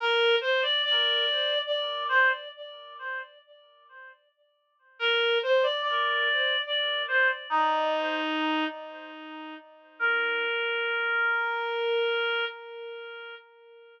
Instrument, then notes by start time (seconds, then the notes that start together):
clarinet
0.00 A#4
0.41 C5
0.62 D5
0.84 D5
1.66 D5
2.09 C5
4.99 A#4
5.43 C5
5.63 D5
5.82 D5
6.66 D5
7.08 C5
7.50 D#4
9.99 A#4